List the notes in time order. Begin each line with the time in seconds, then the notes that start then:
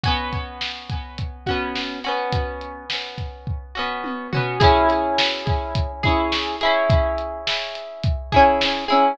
0.03 B3 C#4 F#4, kick, closed hi-hat
0.33 kick, closed hi-hat
0.61 snare
0.90 kick, closed hi-hat
1.18 kick, closed hi-hat
1.46 C#4 F#4, kick, closed hi-hat
1.50 B3
1.75 snare
2.04 C#4 F#4, closed hi-hat
2.08 B3
2.33 kick, closed hi-hat
2.61 closed hi-hat
2.90 snare
3.18 kick, closed hi-hat
3.47 kick
3.75 B3 C#4 F#4
4.04 high tom
4.33 B3 C#4 F#4, floor tom
4.60 C#4 E4 G#4, kick, closed hi-hat
4.90 closed hi-hat
5.18 snare
5.47 kick, closed hi-hat
5.75 kick, closed hi-hat
6.03 C#4 E4 G#4, kick, closed hi-hat
6.32 snare
6.61 C#4 E4 G#4, closed hi-hat
6.90 kick, closed hi-hat
7.18 closed hi-hat
7.47 snare
7.75 closed hi-hat
8.03 kick, closed hi-hat
8.32 C#4 E4 G#4, kick, closed hi-hat
8.61 snare
8.88 C#4 E4 G#4, closed hi-hat